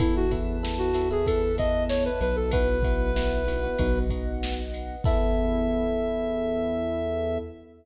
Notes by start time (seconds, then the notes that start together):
0.00 E2 B3 E4 A4 B4 E5 A5, kick, ride
0.16 F#4
0.31 B3 E4 A4, kick, ride
0.63 B3 E4 A4, snare
0.78 F#4
0.94 B3 E4 A4, snare, ride
1.11 B3 E4 G#4 A4
1.26 B3 E4 A4, kick, ride
1.58 B3 E4 A4 D#5, kick, ride
1.89 C#5, snare
2.05 B4
2.21 B1 B4, ride
2.36 A4
2.51 B3 E4 F#4 B4 E5 F#5, kick, ride
2.83 B3 E4 F#4, kick, ride
3.16 B3 E4 F#4, snare
3.47 B3 E4 F#4, snare, ride
3.63 B3 E4 F#4
3.78 B1 B3 D#4 F#4 B4 D#5 F#5, kick, ride
4.10 B3 D#4 F#4, kick, ride
4.43 snare
4.74 ride
5.04 E2 B3 E4 A4 E5, kick, crash